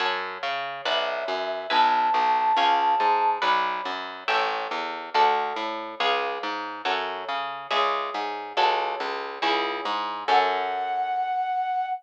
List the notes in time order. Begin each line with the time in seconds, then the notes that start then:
0.00 F#2 C#5 F#5 A5
0.43 C#3
0.85 B1 B4 D5 E5 F#5
1.28 F#2
1.70 B1 B4 E5 G#5 A5
2.14 B1
2.57 C#2 C#5 F5 G#5
3.00 G#2
3.42 B1 B4 D5 F#5
3.85 F#2
4.28 A1 A4 C#5 E5 G5
4.71 E2
5.14 D2 A4 D5 F#5
5.56 A2
6.00 C#2 G#4 C#5 F5
6.43 G#2
6.85 F#2 A4 C#5 F#5
7.29 C#3
7.71 C#2 G#4 C#5 E5
8.14 G#2
8.57 C#2 F#4 A4 C#5
9.00 C#2
9.42 C#2 E4 G#4 C#5
9.85 G#2
10.28 F#2 C#4 F#4 A4 F#5